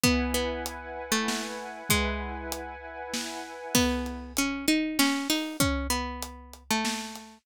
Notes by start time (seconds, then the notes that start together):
0.03 B3 E4 B4 F#5 G#5, kick, closed hi-hat
0.34 B3
0.66 closed hi-hat
1.12 A3
1.28 snare
1.89 G#3 E4 B4 F#5 G#5, kick, closed hi-hat
2.52 closed hi-hat
3.14 snare
3.75 B3, kick, crash
4.06 closed hi-hat
4.37 C#4, closed hi-hat
4.68 D#4, closed hi-hat
4.99 C#4, snare
5.30 D#4, open hi-hat
5.60 C#4, kick, closed hi-hat
5.90 B3, closed hi-hat
6.22 closed hi-hat
6.53 closed hi-hat
6.70 A3
6.85 snare
7.15 closed hi-hat